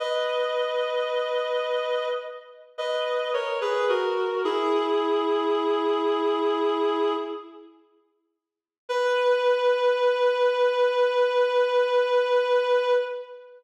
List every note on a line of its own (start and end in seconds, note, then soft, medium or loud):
0.00 2.08 B4 medium
0.00 2.08 D#5 medium
2.78 3.31 B4 medium
2.78 3.31 D#5 medium
3.33 3.60 A#4 medium
3.33 3.60 C#5 medium
3.61 3.87 G#4 medium
3.61 3.87 B4 medium
3.89 4.43 F#4 medium
3.89 4.43 A#4 medium
4.44 7.14 E4 medium
4.44 7.14 G#4 medium
8.89 12.93 B4 loud